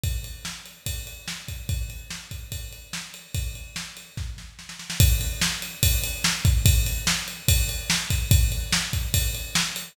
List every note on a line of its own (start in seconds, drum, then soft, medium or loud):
0.04 kick medium
0.04 ride medium
0.24 ride medium
0.45 snare medium
0.66 ride medium
0.86 kick medium
0.86 ride medium
1.07 ride medium
1.28 snare medium
1.48 kick medium
1.48 ride medium
1.69 kick medium
1.69 ride medium
1.90 ride medium
2.10 snare medium
2.31 kick medium
2.31 ride medium
2.52 kick medium
2.52 ride medium
2.72 ride medium
2.93 snare loud
3.14 ride medium
3.34 kick medium
3.34 ride medium
3.55 ride medium
3.76 snare medium
3.97 ride medium
4.17 kick medium
4.17 snare medium
4.38 snare medium
4.59 snare medium
4.69 snare medium
4.79 snare medium
4.90 snare loud
5.00 kick loud
5.00 ride loud
5.21 ride medium
5.41 snare loud
5.62 ride medium
5.83 kick loud
5.83 ride loud
6.04 ride loud
6.24 snare loud
6.45 kick loud
6.45 ride loud
6.66 kick loud
6.66 ride loud
6.86 ride loud
7.07 snare loud
7.28 ride medium
7.48 kick loud
7.48 ride loud
7.69 ride medium
7.90 snare loud
8.10 kick loud
8.10 ride loud
8.31 kick loud
8.31 ride loud
8.52 ride medium
8.72 snare loud
8.93 kick medium
8.93 ride medium
9.14 kick loud
9.14 ride loud
9.35 ride medium
9.55 snare loud
9.76 ride medium